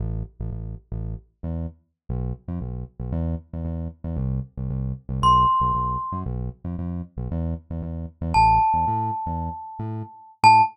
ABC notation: X:1
M:4/4
L:1/16
Q:1/4=115
K:Am
V:1 name="Glockenspiel"
z16 | z16 | z8 c'8 | z16 |
a16 | a4 z12 |]
V:2 name="Synth Bass 1" clef=bass
A,,,3 A,,, A,,,3 A,,,4 E,,5 | B,,,3 F,, B,,,3 B,,, E,,3 E,, E,,3 E,, | C,,3 C,, C,,3 C,, B,,,3 B,,, B,,,3 ^F,, | B,,,3 F,, F,,3 B,,, E,,3 E,, E,,3 E,, |
A,,,3 E,, A,,3 E,,4 A,,5 | A,,4 z12 |]